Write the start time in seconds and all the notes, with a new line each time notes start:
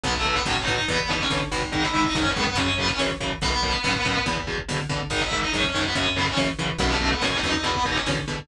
0.04 B1 B2 F#3 B3 B4, kick, closed hi-hat
0.14 A3 A4, kick
0.25 B2 F#3, kick
0.35 B3 B4, kick
0.45 A2 B2 F#3 C#4 C#5, kick, snare
0.56 kick
0.60 D#4 D#5
0.67 A2 B2 F#3, kick
0.73 D#4 D#5
0.78 kick
0.88 E2 B2 E3 B3 B4, kick, closed hi-hat
0.99 kick
1.09 B2 E3 D#4 D#5, kick
1.20 C#4 C#5, kick
1.30 B2 D3 E3, kick, snare
1.40 kick
1.51 G#1 B2 E3, kick
1.62 kick
1.72 G#2 D#3 D#4 D#5, kick, closed hi-hat
1.83 E4 E5, kick
1.94 G#2 D#3, kick
2.04 D#4 D#5, kick
2.15 F#2 G#2 D#3 C#4 C#5, kick, snare
2.25 kick
2.30 B3 B4
2.36 F#2 G#2 D#3, kick
2.43 B3 B4
2.47 kick
2.55 F#2 C#3 C#4 C#5, kick, closed hi-hat
2.68 kick
2.78 F#2 C#3 B3 B4, kick
2.88 C#4 C#5, kick
2.99 F#2 C#3 E3, kick, snare
3.10 kick
3.20 F#2 C#3 E3, kick
3.31 kick
3.41 B1 F#2 B2 B3 B4, kick, closed hi-hat
3.52 kick
3.63 F#2 B2, kick
3.73 kick
3.84 F#2 A2 B2, kick, snare
3.95 kick
4.05 F#2 A2 B2, kick
4.15 kick
4.26 E2 B2, kick, closed hi-hat
4.37 kick
4.47 E2 B2, kick
4.58 kick
4.68 E2 B2 D3, kick, snare
4.79 kick
4.89 E2 B2 D3, kick
5.00 kick
5.10 G#1 G#2 D#3 D#4 D#5, kick, closed hi-hat
5.21 E4 E5, kick
5.31 G#2 D#3, kick
5.41 D#4 D#5, kick
5.53 F#2 G#2 D#3 C#4 C#5, kick, snare
5.64 kick
5.68 C#4 C#5
5.74 F#2 G#2 D#3, kick
5.81 B3 B4, kick
5.95 F#2 C#3 C#4 C#5, kick, closed hi-hat
6.06 kick
6.16 F#2 C#3 B3 B4, kick
6.26 C#4 C#5, kick
6.37 F#2 C#3 E3, kick, snare
6.48 kick
6.58 F#2 C#3 E3, kick
6.69 kick
6.78 B1 F#2 B2 B3 B4, kick, closed hi-hat
6.90 A3 A4, kick
7.01 F#2 B2, kick
7.11 B3 B4, kick
7.22 F#2 A2 B2 C#4 C#5, kick, snare
7.32 kick
7.36 D#4 D#5
7.43 E2 F#2 B2, kick
7.49 D#4 D#5
7.54 kick
7.63 E2 B2 B3 B4, kick, closed hi-hat
7.75 kick
7.85 E2 B2 D#4 D#5, kick
7.96 C#4 C#5, kick
8.06 E2 B2 D3, kick, snare
8.17 kick
8.27 E2 B2 D3, kick
8.38 kick